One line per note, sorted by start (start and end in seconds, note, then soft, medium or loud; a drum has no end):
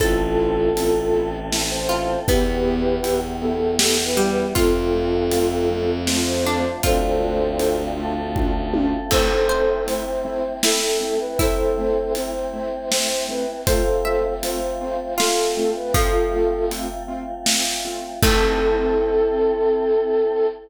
0.00 0.70 A1 loud
0.00 0.14 C4 medium
0.00 2.25 C4 loud
0.00 0.14 E4 medium
0.00 2.25 E4 medium
0.00 1.28 F4 medium
0.00 0.14 A4 medium
0.00 1.28 A4 medium
0.00 2.25 A4 loud
0.00 1.30 A4 medium
0.00 kick medium
0.00 closed hi-hat medium
0.39 0.54 C4 medium
0.39 0.54 E4 medium
0.39 0.54 A4 medium
0.75 2.15 A1 medium
0.75 0.90 C4 medium
0.75 0.90 E4 medium
0.75 0.90 A4 medium
0.75 closed hi-hat loud
1.13 1.29 C4 medium
1.13 1.29 E4 medium
1.13 1.29 A4 medium
1.52 1.67 C4 medium
1.52 1.67 E4 medium
1.52 1.67 A4 medium
1.52 snare medium
1.70 2.20 C5 medium
1.89 2.05 C4 medium
1.89 2.05 E4 medium
1.89 2.21 F4 medium
1.89 2.05 A4 medium
2.27 2.97 E2 loud
2.27 2.43 B3 loud
2.27 4.54 B3 medium
2.27 3.50 B3 medium
2.27 2.43 E4 loud
2.27 4.54 E4 medium
2.27 3.20 G4 medium
2.27 2.43 G4 loud
2.27 4.54 G4 medium
2.27 3.20 B4 medium
2.27 kick medium
2.27 closed hi-hat medium
2.65 2.80 B3 medium
2.65 2.80 E4 medium
2.65 2.80 G4 medium
3.03 4.44 E2 medium
3.03 3.18 B3 medium
3.03 3.18 E4 medium
3.03 3.18 G4 medium
3.03 closed hi-hat medium
3.41 3.57 B3 medium
3.41 3.57 E4 medium
3.41 3.57 G4 medium
3.41 3.75 A4 medium
3.79 3.95 B3 medium
3.79 3.95 E4 medium
3.79 3.95 G4 medium
3.79 4.04 A4 medium
3.79 snare loud
4.05 4.29 B4 medium
4.17 4.54 G3 medium
4.17 4.33 B3 medium
4.17 4.33 E4 medium
4.17 4.33 G4 medium
4.30 4.54 B4 medium
4.55 6.65 F2 loud
4.55 5.68 A3 loud
4.55 4.71 A3 medium
4.55 5.68 C4 medium
4.55 4.71 C4 loud
4.55 5.68 F4 loud
4.55 6.03 F4 medium
4.55 4.71 F4 loud
4.55 5.90 F4 medium
4.55 5.90 A4 medium
4.55 kick medium
4.55 closed hi-hat loud
4.94 5.09 A3 medium
4.94 5.09 C4 medium
4.94 5.09 F4 medium
5.31 5.47 A3 medium
5.31 5.47 C4 medium
5.31 5.47 F4 medium
5.31 closed hi-hat loud
5.69 6.82 F3 medium
5.69 6.82 A3 medium
5.69 5.85 A3 medium
5.69 5.85 C4 medium
5.69 6.82 F4 loud
5.69 5.85 F4 medium
6.07 6.24 A3 medium
6.07 6.24 C4 medium
6.07 6.24 F4 medium
6.07 snare medium
6.27 6.76 C5 medium
6.45 6.61 A3 medium
6.45 6.61 C4 medium
6.45 6.81 D4 medium
6.45 6.61 F4 medium
6.83 8.94 D2 medium
6.83 6.99 A3 loud
6.83 7.97 A3 loud
6.83 6.99 C4 loud
6.83 7.97 C4 loud
6.83 6.99 D4 loud
6.83 7.97 D4 medium
6.83 7.54 F4 medium
6.83 6.99 F4 medium
6.83 7.97 F4 loud
6.83 7.81 A4 medium
6.83 7.81 C5 medium
6.83 kick medium
6.83 closed hi-hat loud
7.21 7.36 A3 medium
7.21 7.36 C4 medium
7.21 7.36 D4 medium
7.21 7.36 F4 medium
7.59 7.75 A3 medium
7.59 7.75 C4 medium
7.59 7.75 D4 medium
7.59 7.75 F4 medium
7.59 closed hi-hat medium
7.97 9.10 A3 medium
7.97 8.13 A3 medium
7.97 9.10 C4 medium
7.97 8.13 C4 medium
7.97 8.13 D4 medium
7.97 9.10 F4 loud
7.97 8.13 F4 medium
7.97 9.10 A4 loud
8.36 8.51 A3 medium
8.36 8.51 C4 medium
8.36 8.51 D4 medium
8.36 8.51 F4 medium
8.36 kick medium
8.36 high tom medium
8.74 8.89 A3 medium
8.74 8.89 C4 medium
8.74 8.89 D4 medium
8.74 8.89 F4 medium
8.74 high tom loud
9.11 13.62 A3 medium
9.11 9.27 A3 medium
9.11 13.62 C4 loud
9.11 9.27 C4 medium
9.11 13.62 E4 medium
9.11 9.27 E4 medium
9.11 9.43 A4 medium
9.11 9.84 A4 medium
9.11 9.84 C5 loud
9.11 kick medium
9.11 crash loud
9.49 9.65 A3 medium
9.49 9.65 C4 medium
9.49 9.65 E4 medium
9.49 10.53 C5 medium
9.87 10.02 A3 medium
9.87 10.02 C4 medium
9.87 10.02 E4 medium
9.87 10.56 C5 medium
9.87 closed hi-hat medium
10.25 10.40 A3 medium
10.25 10.40 C4 medium
10.25 10.40 E4 medium
10.63 10.78 A3 medium
10.63 10.78 C4 medium
10.63 10.78 E4 medium
10.63 11.35 E4 medium
10.63 11.19 A4 medium
10.63 snare loud
11.00 11.16 A3 medium
11.00 11.16 C4 medium
11.00 11.16 E4 medium
11.20 11.38 B4 medium
11.39 11.55 A3 medium
11.39 11.55 C4 medium
11.39 13.53 E4 medium
11.39 11.55 E4 medium
11.39 12.13 A4 medium
11.39 12.13 C5 medium
11.39 kick medium
11.39 closed hi-hat medium
11.78 11.93 A3 medium
11.78 11.93 C4 medium
11.78 11.93 E4 medium
12.15 12.31 A3 medium
12.15 12.31 C4 medium
12.15 12.31 E4 medium
12.15 12.89 C5 medium
12.15 closed hi-hat medium
12.53 12.69 A3 medium
12.53 12.69 C4 medium
12.53 12.69 E4 medium
12.91 13.06 A3 medium
12.91 13.06 C4 medium
12.91 13.06 E4 medium
12.91 13.26 C5 medium
12.91 snare loud
13.29 13.44 A3 medium
13.29 13.44 C4 medium
13.29 13.44 E4 medium
13.29 13.61 B4 medium
13.67 13.82 A3 medium
13.67 18.18 A3 medium
13.67 13.82 C4 medium
13.67 18.18 C4 medium
13.67 13.82 F4 loud
13.67 18.18 F4 loud
13.67 14.33 A4 medium
13.67 14.33 C5 medium
13.67 14.02 C5 medium
13.67 kick medium
13.67 closed hi-hat loud
14.05 14.20 A3 medium
14.05 14.20 C4 medium
14.05 14.20 F4 medium
14.05 14.98 E5 medium
14.43 14.58 A3 medium
14.43 14.58 C4 medium
14.43 14.58 F4 medium
14.43 15.14 C5 medium
14.43 closed hi-hat loud
14.81 14.96 A3 medium
14.81 14.96 C4 medium
14.81 14.96 F4 medium
15.18 15.35 A3 medium
15.18 15.35 C4 medium
15.18 15.80 F4 medium
15.18 15.35 F4 medium
15.18 15.71 A4 medium
15.18 snare loud
15.57 15.72 A3 medium
15.57 15.72 C4 medium
15.57 15.72 F4 medium
15.76 15.94 B4 medium
15.94 16.95 F3 medium
15.94 16.10 A3 medium
15.94 16.10 C4 medium
15.94 16.10 F4 medium
15.94 16.65 F4 medium
15.94 16.65 A4 medium
15.94 kick loud
15.94 closed hi-hat loud
16.33 16.48 A3 medium
16.33 16.48 C4 medium
16.33 16.48 F4 medium
16.71 16.86 A3 medium
16.71 16.86 C4 medium
16.71 16.86 F4 medium
16.71 closed hi-hat medium
17.08 17.23 A3 medium
17.08 17.23 C4 medium
17.08 17.23 F4 medium
17.46 17.62 A3 medium
17.46 17.62 C4 medium
17.46 17.62 F4 medium
17.46 snare loud
17.85 18.00 A3 medium
17.85 18.00 C4 medium
17.85 18.00 F4 medium
18.22 20.46 A3 loud
18.22 20.47 C4 loud
18.22 20.47 E4 loud
18.22 20.47 E4 medium
18.22 20.46 A4 loud
18.22 20.47 A4 loud
18.22 kick loud
18.22 crash loud